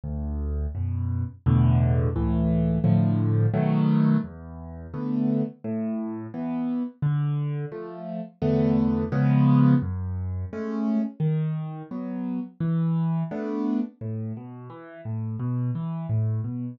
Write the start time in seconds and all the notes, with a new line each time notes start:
0.03 D2
0.75 F#2 B2
1.46 E2 A2 B2 D3
2.15 C#2 A2 E3
2.84 A2 D3 F3
3.53 B2 D#3 F#3 A3
4.24 E2
4.93 D3 A3 B3
5.64 A2
6.34 E3 B3
7.02 D3
7.71 F3 A3
8.41 E2 D3 A3 B3
9.12 C#3 F3 G#3 B3
9.82 F#2
10.52 G#3 A3 C#4
11.19 D#3
11.91 F#3 B3
12.60 E3
13.31 A3 B3 D4
14.01 A2
14.36 B2
14.69 E3
15.05 A2
15.39 B2
15.75 E3
16.09 A2
16.44 B2